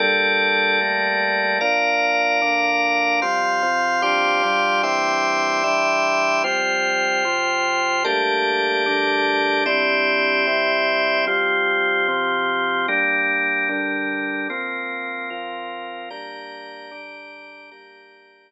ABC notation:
X:1
M:6/8
L:1/8
Q:3/8=149
K:Gdor
V:1 name="Drawbar Organ"
[G,B,DA]6 | [G,A,B,A]6 | [B,,F,D]6 | [B,,D,D]6 |
[F,G,C]3 [C,F,C]3 | [G,,F,CD]3 [G,,F,G,D]3 | [E,G,CD]6 | [E,G,DE]6 |
[F,G,C]6 | [C,F,C]6 | [G,A,B,D]6 | [D,G,A,D]6 |
[C,G,DE]6 | [C,G,CE]6 | [F,G,C]6 | [C,F,C]6 |
[G,B,D]6 | [D,G,D]6 | [F,B,C]6 | [F,CF]6 |
[G,B,D]6 | [D,G,D]6 | [G,B,D]6 |]
V:2 name="Drawbar Organ"
[G,ABd]6- | [G,ABd]6 | [Bdf]6- | [Bdf]6 |
[fc'g']6 | [Gfc'd']6 | [egc'd']6- | [egc'd']6 |
[Fcg]6- | [Fcg]6 | [GBda]6- | [GBda]6 |
[CGde]6- | [CGde]6 | [F,CG]6- | [F,CG]6 |
[G,DB]6- | [G,DB]6 | [F,CB]6- | [F,CB]6 |
[Gdb]6- | [Gdb]6 | [Gdb]6 |]